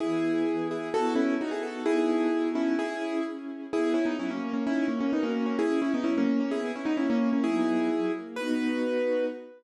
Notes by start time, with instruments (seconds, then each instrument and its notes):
0.00 string ensemble 1 E3 B3 G#4, acoustic grand piano E4 G#4
0.48 string ensemble 1 E3 B3 G#4
0.71 acoustic grand piano E4 G#4
0.93 string ensemble 1 B3 E4 F#4 A4, acoustic grand piano F#4 A4
1.15 acoustic grand piano C#4 E4
1.39 string ensemble 1 B3 D#4 F#4 A4, acoustic grand piano D#4 F#4
1.51 acoustic grand piano E4 G#4
1.63 acoustic grand piano F#4 A4
1.86 string ensemble 1 B3 D#4 F#4 A4, acoustic grand piano E4 G#4
2.33 string ensemble 1 B3 D#4 F#4 A4
2.55 acoustic grand piano C#4 E4
2.79 string ensemble 1 C#4 E4 G#4, acoustic grand piano E4 G#4
3.25 string ensemble 1 C#4 E4 G#4
3.73 string ensemble 1 B3, acoustic grand piano E4 G#4
3.94 acoustic grand piano C#4 E4, string ensemble 1 D#4
4.06 acoustic grand piano B3 D#4
4.17 string ensemble 1 F#3, acoustic grand piano C#4 E4
4.31 acoustic grand piano A#3 C#4
4.42 string ensemble 1 A#4
4.53 acoustic grand piano A#3 C#4
4.65 acoustic grand piano C#4 E4, string ensemble 1 D#4
4.88 acoustic grand piano A#3 C#4, string ensemble 1 F#4
5.00 acoustic grand piano A#3 C#4
5.12 acoustic grand piano B3 D#4, string ensemble 1 C#4 F#4 A#4
5.23 acoustic grand piano A#3 C#4
5.46 acoustic grand piano A#3 C#4
5.59 string ensemble 1 C#4, acoustic grand piano E4 G#4
5.80 acoustic grand piano C#4 E4, string ensemble 1 E4
5.94 acoustic grand piano B3 D#4
6.04 string ensemble 1 F#3, acoustic grand piano C#4 E4
6.18 acoustic grand piano A#3 C#4
6.29 string ensemble 1 A#4
6.40 acoustic grand piano A#3 C#4
6.51 string ensemble 1 B3, acoustic grand piano E4 G#4
6.75 acoustic grand piano C#4 E4, string ensemble 1 D#4
6.85 acoustic grand piano B3 D#4
6.97 string ensemble 1 A#3 C#4 E4, acoustic grand piano C#4 E4
7.10 acoustic grand piano A#3 C#4
7.33 acoustic grand piano A#3 C#4
7.44 string ensemble 1 F#3 B3 D#4, acoustic grand piano E4 G#4
7.89 string ensemble 1 F#3
8.14 string ensemble 1 A#3
8.36 string ensemble 1 B3 D#4 F#4, acoustic grand piano B4